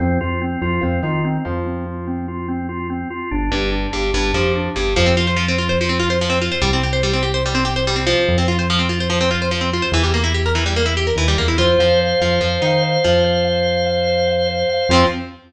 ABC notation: X:1
M:4/4
L:1/16
Q:1/4=145
K:F
V:1 name="Acoustic Guitar (steel)"
F,2 F,4 F,2 F,2 _E4 F,2- | F,16 | z2 G,,4 G,,2 G,,2 F,4 G,,2 | F, C F c F, C F c F, C F c F, C F c |
G, C G c G, C G c G, C G c G, C F,2- | F, C F c F, C F c F, C F c F, C F c | E, G, B, E G B E, G, B, E G B E, G, B, E | F2 F,4 F,2 F,2 _E4 F,2- |
F,16 | [F,C]4 z12 |]
V:2 name="Drawbar Organ"
C2 F2 C2 F2 C2 F2 C2 F2 | C2 F2 C2 F2 C2 F2 C2 F2 | D2 G2 D2 G2 D2 G2 D2 G2 | z16 |
z16 | z16 | z16 | c2 f2 c2 f2 c2 f2 c2 f2 |
c2 f2 c2 f2 c2 f2 c2 f2 | [CF]4 z12 |]
V:3 name="Synth Bass 1" clef=bass
F,,2 F,,4 F,,2 F,,2 _E,4 F,,2- | F,,16 | G,,,2 G,,,4 G,,,2 G,,,2 F,,4 G,,,2 | F,,16 |
C,,16 | F,,16 | E,,12 _E,,2 =E,,2 | F,,2 F,,4 F,,2 F,,2 _E,4 F,,2- |
F,,16 | F,,4 z12 |]